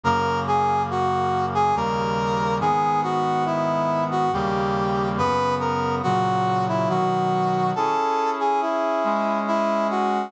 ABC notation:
X:1
M:3/4
L:1/16
Q:1/4=70
K:G#m
V:1 name="Brass Section"
A2 G2 F3 G A4 | G2 F2 E3 F =G4 | B2 A2 F3 E F4 | [K:C#m] A3 G E4 E2 F2 |]
V:2 name="Brass Section"
[F,,C,A,]8 [D,,C,=G,A,]4 | [G,,D,B,]8 [D,,C,=G,A,]4 | [F,,C,B,]4 [A,,C,F,]4 [B,,D,F,]4 | [K:C#m] [CEG]6 [G,CG]6 |]